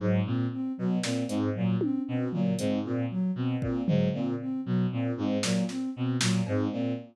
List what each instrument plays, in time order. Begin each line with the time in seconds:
0.00 violin G#2, ocarina F#3
0.25 violin A#2, ocarina C4
0.52 ocarina C4
0.78 violin B2, ocarina F#3
1.03 violin A#2, ocarina C4, snare
1.28 violin G#2, ocarina C4, closed hi-hat
1.55 violin A#2, ocarina F#3
1.81 ocarina C4, high tom
2.07 violin B2, ocarina C4
2.33 violin A#2, ocarina F#3, floor tom
2.59 violin G#2, ocarina C4, closed hi-hat
2.85 violin A#2, ocarina C4
3.10 ocarina F#3
3.35 violin B2, ocarina C4
3.61 violin A#2, ocarina C4, kick
3.87 violin G#2, ocarina F#3, floor tom
4.13 violin A#2, ocarina C4
4.40 ocarina C4
4.65 violin B2, ocarina F#3
4.91 violin A#2, ocarina C4
5.17 violin G#2, ocarina C4
5.43 violin A#2, ocarina F#3, snare
5.69 ocarina C4, snare
5.95 violin B2, ocarina C4
6.21 violin A#2, ocarina F#3, snare
6.47 violin G#2, ocarina C4, cowbell
6.72 violin A#2, ocarina C4